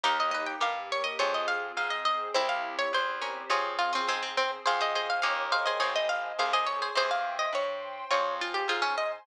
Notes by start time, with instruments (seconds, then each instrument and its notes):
0.04 electric bass (finger) D#2, pad 2 (warm) A#3 D#4 G4, acoustic guitar (steel) A#3 D#4 G4, harpsichord G4 A#4 F5
0.20 harpsichord D#5
0.31 harpsichord B4 D#5
0.47 harpsichord G5
0.60 electric bass (finger) G2, pad 2 (warm) A#3 G4 A#4, harpsichord G4 A#4 F5
0.92 harpsichord C#5
1.04 harpsichord D#5
1.19 electric bass (finger) F2, acoustic guitar (steel) C4 F4 G#4, pad 2 (warm) C4 F4 G#4, harpsichord C#5
1.34 harpsichord D#5
1.48 harpsichord F5
1.77 electric bass (finger) G#2, pad 2 (warm) C4 G#4 C5, harpsichord F5
1.90 harpsichord D#5
2.05 harpsichord D#5
2.34 electric bass (finger) C2, pad 2 (warm) C4 E4 G4, acoustic guitar (steel) C4 E4 G4, harpsichord C4 E4 C5
2.49 harpsichord F5
2.79 harpsichord C#5
2.93 electric bass (finger) E2, pad 2 (warm) C4 G4 C5, harpsichord C5
3.22 harpsichord A#3 C#4
3.50 electric bass (finger) F2, acoustic guitar (steel) C4 F4 G#4, pad 2 (warm) C4 F4 G#4, harpsichord C#4 F4 C#5
3.79 harpsichord F4
3.93 harpsichord C4 C#4 F4
4.07 electric bass (finger) G#2, harpsichord G#3 C4, pad 2 (warm) C4 G#4 C5
4.23 harpsichord C4
4.37 harpsichord C4
4.66 electric bass (finger) F2, acoustic guitar (steel) C4 F4 G#4, harpsichord G#4 C5 F5, pad 2 (warm) C5 F5 G#5
4.81 harpsichord G#4 C5 D#5
4.95 harpsichord G#4 C5 D#5
5.10 harpsichord F5
5.22 electric bass (finger) D#2, acoustic guitar (steel) A#3 C#4 D#4 G4, pad 2 (warm) A#4 C#5 D#5 G5, harpsichord F5
5.52 harpsichord G#4 C5 F5
5.66 harpsichord G#4 C5 D#5
5.80 electric bass (finger) G#1, acoustic guitar (steel) C4 D#4 G#4, harpsichord G#4 C5 C#5, pad 2 (warm) C5 D#5 G#5
5.96 harpsichord D#5
6.09 harpsichord F5
6.39 electric bass (finger) C2, pad 2 (warm) G#4 C5 G#5, harpsichord G#4 C5 F5
6.53 harpsichord G#4 C5 D#5
6.67 harpsichord C#5
6.82 harpsichord G#4 C5
6.95 electric bass (finger) E2, acoustic guitar (steel) C4 E4 G4, harpsichord G#4 C5, pad 2 (warm) C5 E5 G5
7.11 harpsichord F5
7.39 harpsichord D#5
7.53 electric bass (finger) G2, pad 2 (warm) C5 G5 C6, harpsichord C#5
8.11 electric bass (finger) F2, acoustic guitar (steel) C4 F4 G#4, pad 2 (warm) C5 F5 G#5, harpsichord C#5
8.41 harpsichord F4
8.54 harpsichord G4
8.68 electric bass (finger) G#2, harpsichord F4 G#4 C5, pad 2 (warm) C5 G#5 C6
8.82 harpsichord C#4
8.98 harpsichord D#5